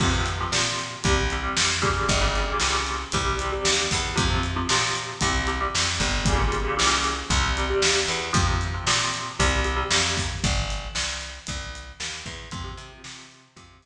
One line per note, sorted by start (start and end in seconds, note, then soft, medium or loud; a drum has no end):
0.00 0.45 F2 medium
0.00 0.10 C3 loud
0.00 0.10 F3 loud
0.00 kick loud
0.00 crash medium
0.13 0.34 C3 medium
0.13 0.34 F3 medium
0.26 closed hi-hat medium
0.40 0.51 C3 medium
0.40 0.51 F3 medium
0.52 0.97 A#2 medium
0.52 0.93 C3 medium
0.52 0.93 F3 medium
0.52 snare loud
0.79 closed hi-hat medium
1.04 1.49 C2 loud
1.04 1.25 C3 loud
1.04 1.25 G3 loud
1.04 kick loud
1.04 closed hi-hat medium
1.30 1.42 C3 medium
1.30 1.42 G3 medium
1.30 closed hi-hat medium
1.43 1.80 C3 medium
1.43 1.80 G3 medium
1.57 2.01 F2 medium
1.57 snare loud
1.82 2.18 A#2 medium
1.82 2.18 C#3 medium
1.82 2.18 G3 loud
1.82 kick medium
1.82 closed hi-hat medium
2.09 2.53 G1 loud
2.09 kick medium
2.09 closed hi-hat medium
2.21 2.42 A#2 medium
2.21 2.42 C#3 medium
2.21 2.42 G3 medium
2.35 closed hi-hat medium
2.47 2.58 A#2 medium
2.47 2.58 C#3 medium
2.47 2.58 G3 medium
2.60 3.05 C2 medium
2.60 3.03 A#2 medium
2.60 3.03 C#3 medium
2.60 3.03 G3 medium
2.60 snare medium
2.87 closed hi-hat medium
3.12 3.58 C2 loud
3.12 3.35 C3 loud
3.12 3.35 G3 loud
3.12 kick medium
3.12 closed hi-hat loud
3.39 3.51 C3 medium
3.39 3.51 G3 medium
3.39 closed hi-hat medium
3.52 3.94 C3 medium
3.52 3.94 G3 medium
3.65 3.88 D#2 medium
3.65 snare loud
3.91 4.16 E2 medium
3.91 kick medium
3.91 open hi-hat medium
4.15 4.62 F2 loud
4.15 4.26 C3 loud
4.15 4.26 F3 loud
4.15 kick loud
4.15 closed hi-hat medium
4.30 4.51 C3 medium
4.30 4.51 F3 medium
4.43 closed hi-hat medium
4.56 4.67 C3 medium
4.56 4.67 F3 medium
4.69 5.14 A#2 medium
4.69 5.12 C3 medium
4.69 5.12 F3 medium
4.69 snare loud
4.95 closed hi-hat medium
5.21 5.66 C2 loud
5.21 5.42 C3 loud
5.21 5.42 G3 medium
5.21 kick medium
5.21 closed hi-hat loud
5.47 5.58 C3 medium
5.47 5.58 G3 medium
5.47 closed hi-hat medium
5.61 6.02 C3 medium
5.61 6.02 G3 medium
5.75 5.99 F2 medium
5.75 snare loud
6.00 6.70 G1 loud
6.00 kick medium
6.00 closed hi-hat medium
6.25 6.37 A#2 medium
6.25 6.37 C#3 loud
6.25 6.37 G3 loud
6.25 kick loud
6.25 closed hi-hat loud
6.38 6.59 A#2 loud
6.38 6.59 C#3 loud
6.38 6.59 G3 medium
6.52 closed hi-hat medium
6.64 6.75 A#2 medium
6.64 6.75 C#3 medium
6.64 6.75 G3 medium
6.77 7.23 C2 medium
6.77 7.18 A#2 medium
6.77 7.18 C#3 medium
6.77 7.18 G3 medium
6.77 snare loud
7.04 closed hi-hat medium
7.30 7.74 C2 loud
7.30 7.51 C3 loud
7.30 7.51 G3 loud
7.30 kick medium
7.30 closed hi-hat medium
7.57 7.68 C3 medium
7.57 7.68 G3 medium
7.57 closed hi-hat medium
7.70 8.12 C3 medium
7.70 8.12 G3 medium
7.82 8.05 D#2 medium
7.82 snare loud
8.08 8.32 E2 medium
8.08 closed hi-hat medium
8.33 8.78 F2 loud
8.33 8.43 C3 medium
8.33 8.43 F3 medium
8.33 kick loud
8.33 closed hi-hat loud
8.46 8.67 C3 medium
8.46 8.67 F3 medium
8.61 closed hi-hat medium
8.74 8.84 C3 medium
8.74 8.84 F3 medium
8.87 9.31 A#2 medium
8.87 9.29 C3 medium
8.87 9.29 F3 medium
8.87 snare loud
9.14 closed hi-hat medium
9.39 9.84 C2 loud
9.39 9.60 C3 medium
9.39 9.60 G3 loud
9.39 kick medium
9.39 closed hi-hat medium
9.64 9.75 C3 medium
9.64 9.75 G3 medium
9.64 closed hi-hat medium
9.76 10.18 C3 medium
9.76 10.18 G3 medium
9.91 10.35 F2 medium
9.91 snare loud
10.17 kick medium
10.17 open hi-hat medium
10.44 10.88 G1 loud
10.44 kick loud
10.44 closed hi-hat medium
10.70 closed hi-hat medium
10.95 11.39 C2 medium
10.95 snare loud
11.21 closed hi-hat medium
11.47 11.93 C2 loud
11.47 kick medium
11.47 closed hi-hat medium
11.75 closed hi-hat medium
12.00 12.23 D#2 medium
12.00 snare loud
12.26 12.49 E2 medium
12.26 kick medium
12.26 closed hi-hat medium
12.51 12.74 F2 loud
12.51 12.62 C3 loud
12.51 12.62 F3 loud
12.51 kick loud
12.51 closed hi-hat medium
12.64 12.85 C3 medium
12.64 12.85 F3 medium
12.77 13.00 C3 medium
12.77 closed hi-hat medium
12.92 13.02 C3 medium
12.92 13.02 F3 medium
13.04 13.49 C3 medium
13.04 13.47 C3 medium
13.04 13.47 F3 medium
13.04 snare loud
13.31 closed hi-hat medium
13.56 13.79 F2 loud
13.56 13.77 C3 loud
13.56 13.77 F3 loud
13.56 kick medium
13.56 closed hi-hat loud
13.82 13.86 C3 medium
13.82 13.86 F3 medium
13.82 closed hi-hat medium